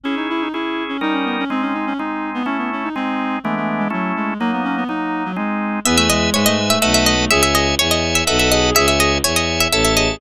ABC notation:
X:1
M:3/4
L:1/16
Q:1/4=124
K:C#m
V:1 name="Harpsichord"
z12 | z12 | z12 | z12 |
[K:E] e e d2 c d2 e e e d2 | e e d2 c d2 e e e d2 | e e d2 c d2 e e e d2 |]
V:2 name="Clarinet"
C D E D E3 C D C B, C | ^B, C D C D3 =B, C B, C D | ^B,4 A, A,2 G, F,2 G,2 | ^A, B, C B, D3 F, G,4 |
[K:E] B, A, G,2 G, A, G, A, A,3 A, | G z G z5 A2 G2 | G z G z5 A2 G2 |]
V:3 name="Drawbar Organ"
[CEG]4 [CEG]4 [=G,CD^A]4 | [G,^B,D]4 [G,B,D]4 [A,CE]4 | [G,^B,D]4 [E,G,=B,=D]4 [A,CE]4 | [F,^A,D]4 [F,A,D]4 [G,^B,D]4 |
[K:E] [Beg]4 [Beg]4 [Bdfa]4 | [ceg]4 [ceg]4 [Bdfa]4 | [ceg]4 [ceg]4 [cea]4 |]
V:4 name="Violin" clef=bass
z12 | z12 | z12 | z12 |
[K:E] E,,4 G,,4 B,,,4 | C,,4 E,,4 B,,,4 | C,,4 E,,4 A,,,4 |]